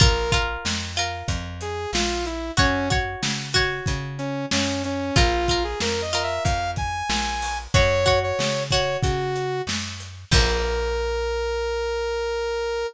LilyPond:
<<
  \new Staff \with { instrumentName = "Lead 2 (sawtooth)" } { \time 4/4 \key bes \minor \tempo 4 = 93 bes'8 r2 aes'8 f'8 e'8 | des'8 r2 des'8 des'8 des'8 | f'8. aes'16 \tuplet 3/2 { bes'8 ees''8 e''8 } f''8 aes''4. | des''8. des''8. des''8 ges'4 r4 |
bes'1 | }
  \new Staff \with { instrumentName = "Acoustic Guitar (steel)" } { \time 4/4 \key bes \minor <f' bes'>8 <f' bes'>4 <f' bes'>2~ <f' bes'>8 | <ges' des''>8 <ges' des''>4 <ges' des''>2~ <ges' des''>8 | <f' bes'>8 <f' bes'>4 <f' bes'>2~ <f' bes'>8 | <ges' des''>8 <ges' des''>4 <ges' des''>2~ <ges' des''>8 |
<f bes>1 | }
  \new Staff \with { instrumentName = "Electric Bass (finger)" } { \clef bass \time 4/4 \key bes \minor bes,,4 f,4 f,4 bes,,4 | ges,4 des4 des4 ges,4 | bes,,4 f,4 f,4 bes,,4 | ges,4 des4 des4 ges,4 |
bes,,1 | }
  \new DrumStaff \with { instrumentName = "Drums" } \drummode { \time 4/4 <hh bd>8 <hh bd>8 sn8 hh8 <hh bd>8 hh8 sn8 hh8 | <hh bd>8 <hh bd>8 sn8 <hh bd>8 <hh bd>8 hh8 sn8 hh8 | <hh bd>8 <hh bd>8 sn8 hh8 <hh bd>8 <hh bd>8 sn8 hho8 | <hh bd>8 <hh bd>8 sn8 <hh bd>8 <hh bd>8 hh8 sn8 hh8 |
<cymc bd>4 r4 r4 r4 | }
>>